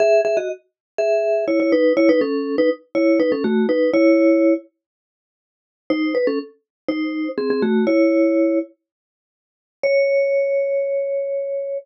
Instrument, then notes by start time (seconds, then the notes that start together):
vibraphone
0.00 G#4 E5
0.25 G#4 E5
0.37 F#4 D#5
0.98 G#4 E5
1.48 E4 C#5
1.60 E4 C#5
1.72 D#4 B4
1.97 E4 C#5
2.09 D#4 B4
2.21 C#4 A4
2.58 D#4 B4
2.95 E4 C#5
3.20 D#4 B4
3.32 C#4 A4
3.44 A3 F#4
3.69 D#4 B4
3.94 E4 C#5
5.90 D#4 C5
6.15 B4
6.27 C#4 A4
6.88 D#4 C5
7.38 C4 G#4
7.50 C4 G#4
7.62 A3 F#4
7.87 E4 C#5
9.83 C#5